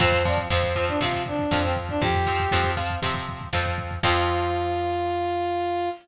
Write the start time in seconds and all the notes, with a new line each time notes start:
0.00 F2 F3 C4 C5, kick, crash
0.12 kick
0.25 F3 C4 D5, kick, closed hi-hat
0.38 kick
0.50 F2 F3 C4 C5, kick, snare
0.63 kick
0.75 F3 C4, kick, closed hi-hat
0.88 D4, kick
1.01 C3 F3 C4 F4, kick, closed hi-hat
1.13 kick
1.26 D4, kick, closed hi-hat
1.39 kick
1.51 F2 F3 C4, kick, snare
1.63 C4, kick
1.76 kick, closed hi-hat
1.89 D4, kick
2.01 F2 G4, kick, closed hi-hat
2.14 kick
2.26 F3 C4, kick, closed hi-hat
2.40 kick
2.51 F2 F3 C4, kick, snare
2.64 kick
2.77 F3 C4, kick, closed hi-hat
2.90 kick
3.02 C3 F3 C4, kick, closed hi-hat
3.14 kick
3.28 kick, closed hi-hat
3.41 kick
3.53 F2 F3 C4, kick, snare
3.66 kick
3.78 kick, closed hi-hat
3.91 kick
4.03 F2 F3 C4 F4, kick, crash